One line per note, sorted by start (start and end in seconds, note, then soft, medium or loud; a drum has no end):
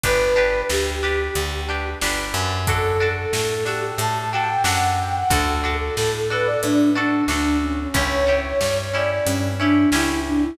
0.04 0.63 G1 medium
0.04 0.34 D4 medium
0.04 0.34 G4 medium
0.04 0.62 B4 medium
0.04 0.34 B4 medium
0.04 kick loud
0.04 closed hi-hat loud
0.36 0.97 D4 medium
0.36 0.97 G4 medium
0.36 0.97 B4 medium
0.70 1.29 D2 medium
0.70 1.88 G4 medium
0.70 snare loud
1.03 1.63 D4 medium
1.03 1.63 G4 medium
1.03 1.63 B4 medium
1.35 1.95 D2 medium
1.35 closed hi-hat loud
1.69 1.99 D4 medium
1.69 1.99 G4 medium
1.69 1.99 B4 medium
2.02 2.33 G1 medium
2.02 2.63 D4 medium
2.02 2.63 G4 medium
2.02 2.63 B4 medium
2.02 snare loud
2.34 3.26 F#2 medium
2.67 2.98 D4 medium
2.67 2.98 F#4 medium
2.67 3.14 A4 medium
2.67 2.98 A4 medium
2.67 kick loud
2.67 closed hi-hat loud
3.00 3.61 D4 medium
3.00 3.61 F#4 medium
3.00 3.61 A4 medium
3.16 3.31 A4 medium
3.33 3.92 A2 medium
3.33 3.49 A4 medium
3.33 snare loud
3.49 3.65 A4 medium
3.66 4.26 D4 medium
3.66 4.26 F#4 medium
3.66 3.81 G4 medium
3.66 4.26 A4 medium
3.66 snare medium
3.82 3.98 G4 medium
3.98 4.58 A2 medium
3.98 4.30 A5 medium
3.98 closed hi-hat loud
4.32 4.63 D4 medium
4.32 4.63 F#4 medium
4.32 4.63 A4 medium
4.32 4.63 G5 medium
4.64 5.23 F#2 medium
4.64 5.25 D4 medium
4.64 5.25 F#4 medium
4.64 5.25 A4 medium
4.64 4.96 F#5 medium
4.64 snare loud
5.00 5.15 G5 medium
5.16 5.32 F#5 medium
5.30 5.90 D2 medium
5.30 5.61 D4 medium
5.30 5.61 F#4 medium
5.30 5.74 A4 medium
5.30 5.61 A4 medium
5.30 kick loud
5.30 closed hi-hat loud
5.64 6.24 D4 medium
5.64 6.24 F#4 medium
5.64 6.24 A4 medium
5.80 5.96 A4 medium
5.97 6.57 A2 medium
5.97 6.13 A4 medium
5.97 snare loud
6.15 6.31 A4 medium
6.30 6.91 D4 medium
6.30 6.91 F#4 medium
6.30 6.91 A4 medium
6.30 6.47 B4 medium
6.45 6.61 D5 medium
6.63 7.23 A2 medium
6.63 6.90 D4 medium
6.63 closed hi-hat loud
6.95 7.26 D4 medium
6.95 7.24 D4 medium
6.95 7.26 F#4 medium
6.95 7.26 A4 medium
7.28 7.87 D2 medium
7.28 7.89 D4 medium
7.28 7.57 D4 medium
7.28 7.89 F#4 medium
7.28 7.89 A4 medium
7.28 snare medium
7.62 7.78 C#4 medium
7.80 7.96 C#4 medium
7.94 8.53 C#2 medium
7.94 8.25 C#4 medium
7.94 8.25 E4 medium
7.94 8.25 G4 medium
7.94 8.38 C#5 medium
7.94 kick loud
7.94 closed hi-hat loud
8.27 8.88 C#4 medium
8.27 8.88 E4 medium
8.27 8.88 G4 medium
8.44 8.59 C#5 medium
8.60 9.20 G2 medium
8.60 8.76 C#5 medium
8.60 snare loud
8.78 8.93 C#5 medium
8.94 9.54 C#4 medium
8.94 9.54 E4 medium
8.94 9.54 G4 medium
8.94 9.10 D5 medium
9.10 9.26 D5 medium
9.25 9.86 G2 medium
9.25 9.53 C#4 medium
9.25 closed hi-hat loud
9.59 9.90 C#4 medium
9.59 9.90 D4 medium
9.59 9.90 E4 medium
9.59 9.90 G4 medium
9.92 10.51 C#2 medium
9.92 10.54 C#4 medium
9.92 10.21 E4 medium
9.92 10.54 E4 medium
9.92 10.54 G4 medium
9.92 snare loud
10.26 10.42 D4 medium
10.43 10.57 E4 medium